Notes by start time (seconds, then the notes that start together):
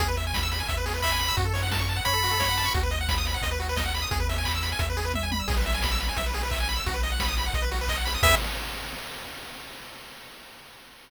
0.00 E2 G#4, kick, closed hi-hat
0.08 B4
0.16 E5, open hi-hat
0.27 G#5
0.34 B5, kick, snare
0.43 E6
0.51 B5, open hi-hat
0.60 G#5
0.68 E2 E5, kick, closed hi-hat
0.77 B4
0.86 G#4, open hi-hat
0.94 B4
1.02 E5 B5, kick, clap
1.11 G#5
1.19 B5, open hi-hat
1.28 E6
1.37 F#2 F#4, kick, closed hi-hat
1.45 A4
1.53 C#5, open hi-hat
1.63 F#5
1.71 A5, kick, snare
1.79 C#6
1.89 A5, open hi-hat
1.96 F#5
2.05 F#2 C#5 B5, kick, closed hi-hat
2.13 A4
2.23 F#4, open hi-hat
2.31 A4
2.39 C#5, kick, snare
2.48 F#5
2.57 A5, open hi-hat
2.65 C#6
2.74 D#2 F#4, kick, closed hi-hat
2.83 B4
2.91 D#5, open hi-hat
3.01 F#5
3.08 B5, kick, snare
3.18 D#6
3.25 B5, open hi-hat
3.34 F#5
3.42 D#2 D#5, kick, closed hi-hat
3.51 B4
3.60 F#4, open hi-hat
3.69 B4
3.76 D#5, kick, snare
3.86 F#5
3.94 B5, open hi-hat
4.02 D#6
4.11 E2 G#4, kick, closed hi-hat
4.20 B4
4.29 E5, open hi-hat
4.38 G#5
4.45 B5, kick, clap
4.55 E6
4.63 B5, open hi-hat
4.72 G#5
4.79 E2 E5, kick, closed hi-hat
4.90 B4
4.97 G#4, open hi-hat
5.05 B4
5.14 E5, kick, high tom
5.23 G#5
5.32 B5, high tom
5.40 E6
5.48 B1 G#4, kick, crash
5.57 B4
5.65 E5, open hi-hat
5.74 G#5
5.82 B5, kick, snare
5.91 E6
5.99 B5, open hi-hat
6.09 G#5
6.17 B1 E5, kick, closed hi-hat
6.26 B4
6.34 G#4, open hi-hat
6.43 B4
6.51 E5, kick, clap
6.60 G#5
6.68 B5, open hi-hat
6.77 E6
6.86 B1 F#4, kick, closed hi-hat
6.94 B4
7.03 D#5, open hi-hat
7.12 F#5
7.20 B5, kick, snare
7.28 D#6
7.36 B5, open hi-hat
7.46 F#5
7.53 B1 D#5, kick, closed hi-hat
7.62 B4
7.71 F#4, open hi-hat
7.81 B4
7.88 D#5, kick, clap
7.97 F#5
8.05 B5, open hi-hat
8.14 D#6
8.23 E2 G#4 B4 E5, kick, crash